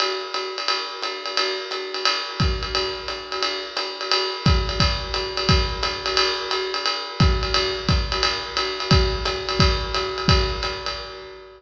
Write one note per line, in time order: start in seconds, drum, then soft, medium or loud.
0.00 ride loud
0.34 hi-hat pedal medium
0.34 ride medium
0.58 ride medium
0.68 ride medium
1.02 hi-hat pedal medium
1.02 ride medium
1.26 ride medium
1.37 ride loud
1.71 hi-hat pedal medium
1.71 ride medium
1.94 ride medium
2.05 ride loud
2.40 kick medium
2.40 hi-hat pedal medium
2.40 ride medium
2.63 ride medium
2.75 ride medium
3.08 hi-hat pedal medium
3.08 ride medium
3.32 ride medium
3.43 ride medium
3.77 hi-hat pedal medium
3.77 ride medium
4.01 ride medium
4.11 ride loud
4.46 kick medium
4.46 hi-hat pedal medium
4.46 ride medium
4.69 ride medium
4.80 kick medium
4.80 ride loud
5.14 hi-hat pedal medium
5.14 ride medium
5.37 ride medium
5.49 kick medium
5.49 ride loud
5.83 hi-hat pedal medium
5.83 ride medium
6.06 ride medium
6.17 ride loud
6.51 hi-hat pedal medium
6.51 ride medium
6.74 ride medium
6.86 ride medium
7.20 kick medium
7.20 hi-hat pedal medium
7.20 ride medium
7.43 ride medium
7.54 ride loud
7.89 kick medium
7.89 hi-hat pedal medium
7.89 ride medium
8.12 ride medium
8.23 ride loud
8.57 hi-hat pedal medium
8.57 ride medium
8.80 ride medium
8.91 kick medium
8.91 ride loud
9.25 hi-hat pedal medium
9.25 ride medium
9.49 ride medium
9.59 kick medium
9.59 ride loud
9.94 hi-hat pedal medium
9.94 ride medium
10.18 ride medium
10.28 kick medium
10.28 ride loud
10.63 hi-hat pedal medium
10.63 ride medium
10.86 ride medium